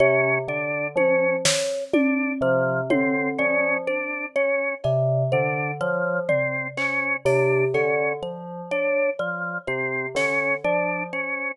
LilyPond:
<<
  \new Staff \with { instrumentName = "Tubular Bells" } { \clef bass \time 4/4 \tempo 4 = 62 c8 d8 f8 r4 c8 d8 f8 | r4 c8 d8 f8 r4 c8 | d8 f8 r4 c8 d8 f8 r8 | }
  \new Staff \with { instrumentName = "Drawbar Organ" } { \time 4/4 des'8 d'8 des'8 r8 d'8 f8 c'8 des'8 | d'8 des'8 r8 d'8 f8 c'8 des'8 d'8 | des'8 r8 d'8 f8 c'8 des'8 d'8 des'8 | }
  \new Staff \with { instrumentName = "Kalimba" } { \time 4/4 des''8 d''8 c''8 des''8 d''8 c''8 des''8 d''8 | c''8 des''8 d''8 c''8 des''8 d''8 c''8 des''8 | d''8 c''8 des''8 d''8 c''8 des''8 d''8 c''8 | }
  \new DrumStaff \with { instrumentName = "Drums" } \drummode { \time 4/4 r4 tommh8 sn8 tommh4 tommh4 | r4 cb4 r8 tomfh8 hc8 hh8 | cb4 r4 r8 sn8 r4 | }
>>